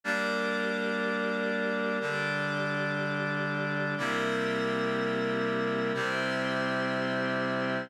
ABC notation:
X:1
M:4/4
L:1/8
Q:1/4=61
K:F
V:1 name="Clarinet"
[G,B,D]4 [D,G,D]4 | [C,G,B,E]4 [C,G,CE]4 |]
V:2 name="Pad 5 (bowed)"
[GBd]4 [DGd]4 | [CGBe]4 [CGce]4 |]